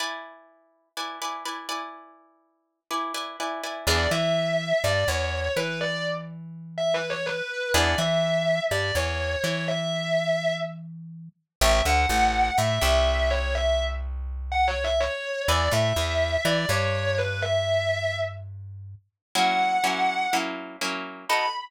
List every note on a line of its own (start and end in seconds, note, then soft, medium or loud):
0.00 0.89 E4 medium
0.00 0.89 B4 medium
0.00 0.89 D5 medium
0.00 0.89 G#5 medium
0.97 1.19 E4 medium
0.97 1.19 B4 medium
0.97 1.19 D5 medium
0.97 1.19 G#5 medium
1.22 1.44 E4 medium
1.22 1.44 B4 medium
1.22 1.44 D5 medium
1.22 1.44 G#5 medium
1.45 1.68 E4 medium
1.45 1.68 B4 medium
1.45 1.68 D5 medium
1.45 1.68 G#5 medium
1.69 2.80 E4 medium
1.69 2.80 B4 medium
1.69 2.80 D5 medium
1.69 2.80 G#5 medium
2.91 3.13 E4 medium
2.91 3.13 B4 medium
2.91 3.13 D5 medium
2.91 3.13 G#5 medium
3.14 3.37 E4 medium
3.14 3.37 B4 medium
3.14 3.37 D5 medium
3.14 3.37 G#5 medium
3.40 3.62 E4 medium
3.40 3.62 B4 medium
3.40 3.62 D5 medium
3.40 3.62 G#5 medium
3.64 3.86 E4 medium
3.64 3.86 B4 medium
3.64 3.86 D5 medium
3.64 3.86 G#5 medium
3.87 4.07 E2 loud
3.87 4.09 B3 loud
3.87 4.09 D4 loud
3.87 4.09 E4 loud
3.87 4.09 G#4 loud
3.87 4.09 D5 medium
4.11 4.73 E3 medium
4.11 4.73 E4 medium
4.11 4.81 E5 medium
4.84 5.04 G2 medium
4.84 5.05 G3 medium
4.84 5.04 D5 medium
5.08 5.49 E2 medium
5.08 5.50 E3 medium
5.08 5.51 C#5 medium
5.57 7.42 E3 medium
5.57 7.42 E4 medium
5.57 5.77 B4 medium
5.81 6.03 D5 medium
6.78 6.93 E5 medium
6.94 7.09 B4 medium
7.10 7.25 C#5 medium
7.26 7.68 B4 medium
7.74 7.95 E2 loud
7.74 7.96 B3 loud
7.74 7.96 D4 medium
7.74 7.96 E4 loud
7.74 7.96 G#4 loud
7.74 7.94 D5 medium
7.98 8.60 E3 medium
7.98 8.60 E4 medium
7.98 8.58 E5 medium
8.71 8.92 G2 medium
8.71 8.92 G3 medium
8.71 8.94 D5 medium
8.95 9.36 E2 medium
8.95 9.37 E3 medium
8.95 9.40 C#5 medium
9.44 11.29 E3 medium
9.44 11.29 E4 medium
9.44 9.63 C#5 medium
9.68 10.51 E5 medium
11.61 11.82 A1 loud
11.61 11.83 C#5 loud
11.61 11.83 E5 loud
11.61 11.82 E5 loud
11.61 11.83 G5 loud
11.61 11.83 A5 medium
11.85 12.06 D2 medium
11.85 12.06 D3 medium
11.85 12.51 F#5 medium
12.09 12.51 A1 medium
12.09 12.52 A3 medium
12.58 12.79 A2 medium
12.58 12.78 A3 medium
12.58 12.81 E5 medium
12.81 15.08 C2 loud
12.81 15.08 C3 medium
12.81 13.30 E5 medium
13.30 13.51 C#5 loud
13.55 13.76 E5 loud
14.52 14.67 F#5 medium
14.68 14.83 C#5 medium
14.84 14.99 E5 medium
15.00 15.42 C#5 medium
15.48 15.69 E2 loud
15.48 15.70 B4 loud
15.48 15.70 D5 loud
15.48 15.70 E5 loud
15.48 15.70 G#5 loud
15.71 15.93 A2 medium
15.71 15.92 A3 medium
15.71 16.41 E5 loud
15.96 16.37 E2 medium
15.96 16.39 E3 medium
16.45 16.66 E3 loud
16.45 16.66 E4 loud
16.45 16.68 D5 loud
16.69 18.95 G2 medium
16.69 18.96 G3 medium
16.69 17.15 C#5 medium
17.18 17.39 B4 medium
17.42 18.12 E5 loud
19.35 19.79 F#3 medium
19.35 19.79 A#3 loud
19.35 19.79 C#4 medium
19.35 19.79 E4 loud
19.35 20.24 F#5 medium
19.84 20.27 F#3 medium
19.84 20.27 A#3 medium
19.84 20.27 C#4 medium
19.84 20.27 E4 medium
20.33 20.77 F#3 medium
20.33 20.77 A#3 medium
20.33 20.77 C#4 medium
20.33 20.77 E4 medium
20.81 21.25 F#3 medium
20.81 21.25 A#3 medium
20.81 21.25 C#4 medium
20.81 21.25 E4 medium
21.29 21.46 B3 medium
21.29 21.46 D#4 loud
21.29 21.46 F#4 loud
21.29 21.46 A4 loud
21.29 21.46 B5 loud